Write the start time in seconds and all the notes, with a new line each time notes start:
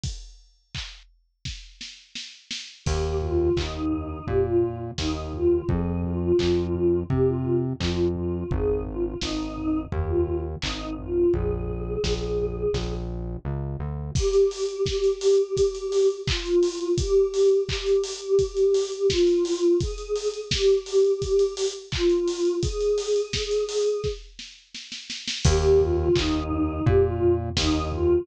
0.04 kick, closed hi-hat
0.75 kick, clap
1.45 kick, snare
1.81 snare
2.15 snare
2.51 snare
2.85 D#2 G4, kick, crash
3.21 F4, floor tom
3.39 F4
3.56 D#2 D#4, kick, clap
3.92 floor tom
4.26 A#2 G4, kick, floor tom
4.46 F4
4.62 floor tom
4.98 D#2 D#4, kick, snare
5.33 F4, floor tom
5.69 F2 G#4, kick, floor tom
6.04 F4, floor tom
6.19 F4
6.39 F2 F4, kick, clap
6.75 floor tom
7.10 C3 G4, kick, floor tom
7.27 F4
7.45 floor tom
7.79 F2 F4, kick, clap
8.15 F4, floor tom
8.51 G#1 G#4, kick, floor tom
8.86 F4, floor tom
9.04 F4
9.21 G#1 D#4, kick, snare
9.57 floor tom
9.92 D#2 G4, kick, floor tom
10.08 F4
10.27 floor tom
10.62 G#1 D#4, kick, clap
10.98 F4, floor tom
11.33 A#1 G#4, kick, floor tom
11.69 floor tom
12.04 A#1, kick, snare
12.39 floor tom
12.73 A#1, kick, snare
13.45 C#2
13.79 D2
14.15 G4, kick, crash
14.33 closed hi-hat
14.51 open hi-hat
14.69 closed hi-hat
14.86 G4, kick, snare
15.04 closed hi-hat
15.21 open hi-hat
15.39 closed hi-hat
15.57 kick, closed hi-hat
15.75 closed hi-hat
15.92 open hi-hat
16.10 closed hi-hat
16.27 F4, kick, clap
16.46 closed hi-hat
16.63 open hi-hat
16.81 closed hi-hat
16.98 G4, kick, closed hi-hat
17.34 open hi-hat
17.51 closed hi-hat
17.68 G4, kick, clap
17.86 closed hi-hat
18.04 open hi-hat
18.22 closed hi-hat
18.39 kick, closed hi-hat
18.57 closed hi-hat
18.74 open hi-hat
18.92 closed hi-hat
19.10 F4, kick, snare
19.27 closed hi-hat
19.45 open hi-hat
19.63 closed hi-hat
19.80 G#4, kick, closed hi-hat
19.98 closed hi-hat
20.16 open hi-hat
20.34 closed hi-hat
20.51 G4, kick, snare
20.69 closed hi-hat
20.86 open hi-hat
21.05 closed hi-hat
21.22 kick, closed hi-hat
21.39 closed hi-hat
21.57 open hi-hat
21.75 closed hi-hat
21.91 F4, kick, clap
22.10 closed hi-hat
22.28 open hi-hat
22.45 closed hi-hat
22.62 G#4, kick, closed hi-hat
22.81 closed hi-hat
22.98 open hi-hat
23.16 closed hi-hat
23.33 kick, snare
23.51 closed hi-hat
23.69 open hi-hat
23.86 closed hi-hat
24.04 kick, snare
24.39 snare
24.75 snare
24.92 snare
25.10 snare
25.28 snare
25.44 D#2 G4, kick, crash
25.79 F4, floor tom
25.98 F4
26.15 D#2 D#4, kick, clap
26.51 floor tom
26.86 A#2 G4, kick, floor tom
27.04 F4
27.21 floor tom
27.56 D#2 D#4, kick, snare
27.92 F4, floor tom